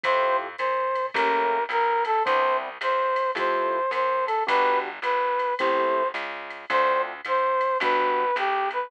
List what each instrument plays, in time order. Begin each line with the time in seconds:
0.03 electric bass (finger) F2, acoustic grand piano A3 E4 F4 G4, brass section C5, kick, ride
0.58 electric bass (finger) A#2, brass section C5, hi-hat pedal, ride
0.95 ride
1.14 electric bass (finger) A1, acoustic grand piano A3 A#3 C#4 G4, brass section A#4, kick, ride
1.69 electric bass (finger) B1, brass section A#4, hi-hat pedal, ride
2.05 brass section A4, ride
2.25 electric bass (finger) C2, acoustic grand piano B3 C4 D4 E4, brass section C5, kick, ride
2.81 electric bass (finger) E2, brass section C5, hi-hat pedal, ride
3.16 ride
3.35 electric bass (finger) F2, acoustic grand piano A3 E4 F4 G4, brass section C5, kick, ride
3.91 electric bass (finger) F#2, brass section C5, hi-hat pedal, ride
4.26 brass section A4, ride
4.47 electric bass (finger) G1, acoustic grand piano B3 D4 F#4 G4, brass section B4, kick, ride
5.02 electric bass (finger) G#1, brass section B4, hi-hat pedal, ride
5.39 ride
5.59 electric bass (finger) A1, acoustic grand piano A3 C4 E4 G4, brass section C5, kick, ride
6.14 electric bass (finger) C#2, hi-hat pedal, ride
6.50 ride
6.70 electric bass (finger) D2, acoustic grand piano A3 C4 D4 F4, brass section C5, kick, ride
7.25 electric bass (finger) G#2, brass section C5, hi-hat pedal, ride
7.61 ride
7.80 electric bass (finger) G1, acoustic grand piano G3 B3 D4 F#4, brass section B4, kick, ride
8.36 electric bass (finger) B1, brass section G4, hi-hat pedal, ride
8.71 brass section B4, ride